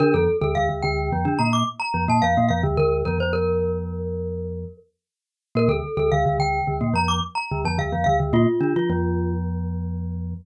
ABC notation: X:1
M:5/4
L:1/16
Q:1/4=108
K:Bb
V:1 name="Glockenspiel"
B A2 A f2 g4 b d' z b2 a f2 f z | B2 B c B12 z4 | B A2 A f2 g4 b d' z b2 a f2 f z | F8 z12 |]
V:2 name="Glockenspiel"
[D,D] [F,,F,] z [D,,D,] [D,,D,] [D,,D,] [D,,D,]2 [F,,F,] [D,D] [B,,B,]2 z2 [F,,F,] [B,,B,] [F,,F,] [B,,B,] [F,,F,] [D,,D,] | [D,,D,]2 [F,,F,] [F,,F,]11 z6 | [B,,B,] [D,,D,] z [D,,D,] [D,,D,] [D,,D,] [D,,D,]2 [D,,D,] [B,,B,] [F,,F,]2 z2 [D,,D,] [F,,F,] [D,,D,] [F,,F,] [D,,D,] [D,,D,] | [B,,B,] z [D,D] [F,F] [F,,F,]12 z4 |]